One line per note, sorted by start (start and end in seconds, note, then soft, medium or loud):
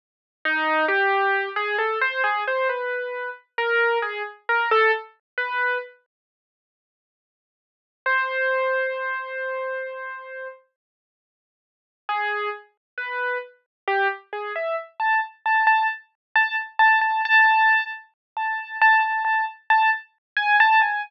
0.45 0.85 D#4 loud
0.88 1.49 G4 medium
1.56 1.76 G#4 medium
1.79 1.99 A4 medium
2.01 2.22 C5 medium
2.24 2.44 G#4 medium
2.48 2.68 C5 medium
2.69 3.30 B4 medium
3.58 3.98 A#4 medium
4.02 4.22 G#4 medium
4.49 4.69 A#4 medium
4.71 4.91 A4 loud
5.38 5.78 B4 medium
8.06 10.48 C5 medium
12.09 12.49 G#4 medium
12.98 13.38 B4 medium
13.87 14.08 G4 medium
14.33 14.53 G#4 medium
14.56 14.76 E5 medium
15.00 15.20 A5 medium
15.46 15.66 A5 medium
15.67 15.87 A5 medium
16.35 16.56 A5 medium
16.79 16.99 A5 loud
17.01 17.21 A5 medium
17.25 17.86 A5 loud
18.37 18.77 A5 medium
18.82 19.02 A5 loud
19.02 19.23 A5 medium
19.25 19.45 A5 medium
19.70 19.90 A5 medium
20.37 20.57 G#5 medium
20.60 20.80 A5 loud
20.82 21.02 G#5 medium